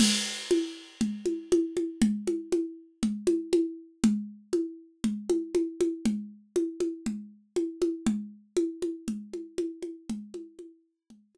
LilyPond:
\new DrumStaff \drummode { \time 4/4 \tempo 4 = 119 <cgl cymc>4 cgho4 cgl8 cgho8 cgho8 cgho8 | cgl8 cgho8 cgho4 cgl8 cgho8 cgho4 | cgl4 cgho4 cgl8 cgho8 cgho8 cgho8 | cgl4 cgho8 cgho8 cgl4 cgho8 cgho8 |
cgl4 cgho8 cgho8 cgl8 cgho8 cgho8 cgho8 | cgl8 cgho8 cgho4 cgl8 cgho8 r4 | }